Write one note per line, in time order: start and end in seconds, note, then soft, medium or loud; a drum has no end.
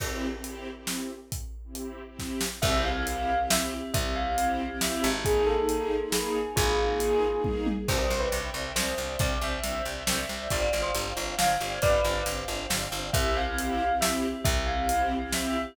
0.00 0.26 C4 loud
0.00 0.26 E4 loud
0.00 0.26 G4 loud
0.00 kick medium
0.00 crash medium
0.33 0.68 C4 medium
0.33 0.68 E4 medium
0.33 0.68 G4 medium
0.44 closed hi-hat medium
0.76 1.11 C4 medium
0.76 1.11 E4 medium
0.76 1.11 G4 medium
0.87 snare medium
1.32 kick medium
1.32 closed hi-hat medium
1.64 1.99 C4 medium
1.64 1.99 E4 medium
1.64 1.99 G4 medium
1.75 closed hi-hat medium
2.08 2.43 C4 medium
2.08 2.43 E4 medium
2.08 2.43 G4 medium
2.19 kick medium
2.19 snare medium
2.41 snare medium
2.62 3.83 C2 medium
2.62 2.89 C4 loud
2.62 5.23 C4 medium
2.62 2.89 E4 loud
2.62 5.23 E4 medium
2.62 2.89 G4 loud
2.62 5.23 G4 medium
2.62 2.82 E5 medium
2.62 kick loud
2.62 crash medium
2.84 3.42 F5 medium
2.96 3.31 C4 medium
2.96 3.31 E4 medium
2.96 3.31 G4 medium
3.07 closed hi-hat medium
3.39 3.74 C4 medium
3.39 3.74 E4 medium
3.39 3.74 G4 loud
3.50 3.89 E5 medium
3.50 snare loud
3.94 4.98 C2 medium
3.94 4.15 E5 medium
3.94 kick loud
3.94 closed hi-hat loud
4.16 4.77 F5 medium
4.27 4.62 C4 medium
4.27 4.62 E4 medium
4.27 4.62 G4 medium
4.38 closed hi-hat medium
4.71 5.06 C4 medium
4.71 5.06 E4 loud
4.71 5.06 G4 loud
4.81 5.20 E5 medium
4.81 snare loud
5.04 6.47 G#1 medium
5.25 7.86 A#3 medium
5.25 5.52 A#3 loud
5.25 7.86 D#4 medium
5.25 5.52 D#4 loud
5.25 5.43 G#4 medium
5.25 7.86 G#4 medium
5.25 5.52 G#4 loud
5.25 kick medium
5.25 closed hi-hat medium
5.47 6.06 A4 medium
5.58 5.94 A#3 medium
5.58 5.94 D#4 loud
5.58 5.94 G#4 medium
5.69 closed hi-hat medium
6.03 6.38 A#3 loud
6.03 6.38 D#4 medium
6.03 6.38 G#4 medium
6.12 6.49 G#4 medium
6.12 snare loud
6.56 7.78 G#1 medium
6.56 7.36 F4 medium
6.56 7.36 G#4 medium
6.56 kick loud
6.56 closed hi-hat loud
6.90 7.25 A#3 medium
6.90 7.25 D#4 medium
6.90 7.25 G#4 loud
7.00 closed hi-hat medium
7.34 7.69 A#3 medium
7.34 7.69 D#4 medium
7.34 7.69 G#4 medium
7.44 kick medium
7.44 high tom medium
7.66 high tom medium
7.88 8.07 C2 medium
7.88 7.97 C4 loud
7.88 7.97 D4 loud
7.88 7.97 E4 loud
7.88 7.97 G4 loud
7.88 10.48 C5 medium
7.88 7.98 C5 medium
7.88 10.48 D5 medium
7.88 10.48 E5 medium
7.88 10.48 G5 medium
7.88 kick loud
7.88 crash medium
7.99 8.17 C5 medium
8.10 8.29 C2 medium
8.10 8.19 C4 medium
8.10 8.19 D4 medium
8.10 8.19 E4 medium
8.10 8.19 G4 loud
8.20 8.31 B4 medium
8.32 8.51 C2 medium
8.32 8.41 C4 medium
8.32 8.41 D4 medium
8.32 8.41 E4 medium
8.32 8.41 G4 medium
8.32 closed hi-hat medium
8.54 8.73 C2 medium
8.54 8.63 C4 loud
8.54 8.63 D4 medium
8.54 8.63 E4 medium
8.54 8.63 G4 medium
8.76 8.95 C2 medium
8.76 8.84 C4 medium
8.76 8.84 D4 medium
8.76 8.84 E4 medium
8.76 8.84 G4 loud
8.76 9.12 C5 medium
8.76 snare medium
8.98 9.17 C2 medium
8.98 9.07 C4 medium
8.98 9.07 D4 medium
8.98 9.07 E4 medium
8.98 9.07 G4 medium
9.19 9.38 C2 medium
9.19 9.29 C4 medium
9.19 9.29 D4 medium
9.19 9.29 E4 medium
9.19 9.29 G4 medium
9.19 9.42 D5 medium
9.19 kick loud
9.19 closed hi-hat medium
9.41 9.60 C2 medium
9.41 9.51 C4 medium
9.41 9.51 D4 medium
9.41 9.51 E4 medium
9.41 9.51 G4 medium
9.41 10.07 E5 medium
9.64 9.82 C2 medium
9.64 9.72 C4 medium
9.64 9.72 D4 medium
9.64 9.72 E4 medium
9.64 9.72 G4 medium
9.64 closed hi-hat medium
9.85 10.04 C2 medium
9.85 9.95 C4 medium
9.85 9.95 D4 medium
9.85 9.95 E4 medium
9.85 9.95 G4 medium
10.07 10.26 C2 medium
10.07 10.16 C4 medium
10.07 10.16 D4 medium
10.07 10.16 E4 medium
10.07 10.16 G4 medium
10.07 10.48 E5 medium
10.07 snare loud
10.29 10.48 C2 medium
10.29 10.38 C4 medium
10.29 10.38 D4 medium
10.29 10.38 E4 medium
10.29 10.38 G4 medium
10.50 10.70 G1 medium
10.50 10.60 C4 loud
10.50 10.60 D4 loud
10.50 10.60 F4 loud
10.50 10.60 G4 loud
10.50 13.11 C5 medium
10.50 13.11 D5 medium
10.50 10.61 D5 medium
10.50 13.11 F5 medium
10.50 13.11 G5 medium
10.50 kick medium
10.50 closed hi-hat medium
10.62 10.80 D5 medium
10.73 10.92 G1 medium
10.73 10.82 C4 medium
10.73 10.82 D4 medium
10.73 10.82 F4 medium
10.73 10.82 G4 medium
10.82 10.92 C5 medium
10.95 11.13 G1 medium
10.95 11.04 C4 medium
10.95 11.04 D4 medium
10.95 11.04 F4 medium
10.95 11.04 G4 medium
10.95 closed hi-hat medium
11.17 11.35 G1 medium
11.17 11.25 C4 loud
11.17 11.25 D4 loud
11.17 11.25 F4 medium
11.17 11.25 G4 medium
11.38 11.57 G1 medium
11.38 11.47 C4 medium
11.38 11.47 D4 medium
11.38 11.47 F4 medium
11.38 11.47 G4 medium
11.38 11.78 F5 medium
11.38 snare loud
11.60 11.79 G1 medium
11.60 11.69 C4 medium
11.60 11.69 D4 medium
11.60 11.69 F4 medium
11.60 11.69 G4 medium
11.82 12.01 G1 medium
11.82 11.92 C4 medium
11.82 11.92 D4 medium
11.82 11.92 F4 medium
11.82 11.92 G4 medium
11.82 12.24 B4 medium
11.82 12.24 D5 medium
11.82 kick loud
11.82 closed hi-hat medium
12.04 12.23 G1 medium
12.04 12.13 C4 medium
12.04 12.13 D4 medium
12.04 12.13 F4 medium
12.04 12.13 G4 medium
12.26 12.45 G1 medium
12.26 12.35 C4 medium
12.26 12.35 D4 medium
12.26 12.35 F4 medium
12.26 12.35 G4 medium
12.26 closed hi-hat medium
12.48 12.67 G1 medium
12.48 12.57 C4 loud
12.48 12.57 D4 medium
12.48 12.57 F4 medium
12.48 12.57 G4 medium
12.70 12.89 G1 medium
12.70 12.79 C4 medium
12.70 12.79 D4 medium
12.70 12.79 F4 medium
12.70 12.79 G4 medium
12.70 snare loud
12.92 13.11 G1 medium
12.92 13.01 C4 medium
12.92 13.01 D4 medium
12.92 13.01 F4 medium
12.92 13.01 G4 medium
13.13 14.35 C2 medium
13.13 13.40 C4 loud
13.13 15.74 C4 medium
13.13 13.40 E4 loud
13.13 15.74 E4 medium
13.13 13.40 G4 loud
13.13 15.74 G4 medium
13.13 13.33 E5 medium
13.13 kick loud
13.13 closed hi-hat loud
13.37 13.95 F5 medium
13.47 13.82 C4 loud
13.47 13.82 E4 loud
13.47 13.82 G4 loud
13.58 closed hi-hat medium
13.90 14.25 C4 medium
13.90 14.25 E4 loud
13.90 14.25 G4 loud
14.01 14.41 E5 medium
14.01 snare loud
14.44 15.66 C2 medium
14.44 14.65 E5 medium
14.44 kick loud
14.44 closed hi-hat loud
14.67 15.27 F5 medium
14.79 15.14 C4 loud
14.79 15.14 E4 medium
14.79 15.14 G4 medium
14.89 closed hi-hat loud
15.21 15.56 C4 loud
15.21 15.56 E4 loud
15.21 15.56 G4 loud
15.32 15.74 E5 medium
15.32 snare medium